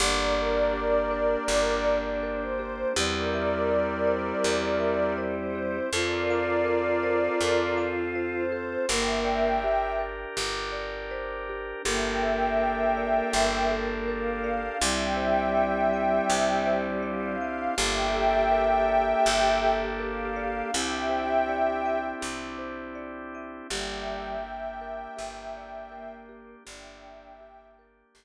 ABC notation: X:1
M:4/4
L:1/8
Q:1/4=81
K:Gdor
V:1 name="Pad 5 (bowed)"
[Bd]6 c2 | [Bd]6 c2 | [Bd]6 c2 | [eg]3 z5 |
[eg]6 f2 | [eg]6 f2 | [eg]6 f2 | [eg]4 z4 |
[eg]8 | [eg]3 z5 |]
V:2 name="Choir Aahs"
D8 | G,8 | F8 | B,2 z6 |
B,8 | G,8 | G8 | G4 z4 |
G,2 z4 B,2 | D2 z6 |]
V:3 name="Marimba"
G d G B G d B G | G e G c G e c G | A f A c A f c A | G d G B G d c G |
G A B d G A B d | G c d e G c d e | G A B d G A B d | G c d e G c d e |
G d G B G d B G | G d G B G z3 |]
V:4 name="Electric Bass (finger)" clef=bass
G,,,4 G,,,4 | E,,4 E,,4 | F,,4 F,,4 | G,,,4 G,,,4 |
G,,,4 G,,,4 | C,,4 C,,4 | G,,,4 G,,,4 | C,,4 C,,4 |
G,,,4 G,,,4 | G,,,4 G,,,4 |]
V:5 name="Drawbar Organ"
[B,DG]8 | [CEG]8 | [CFA]8 | [DGB]8 |
[DGAB]8 | [CDEG]8 | [B,DGA]8 | [CDEG]8 |
[B,DG]8 | [B,DG]8 |]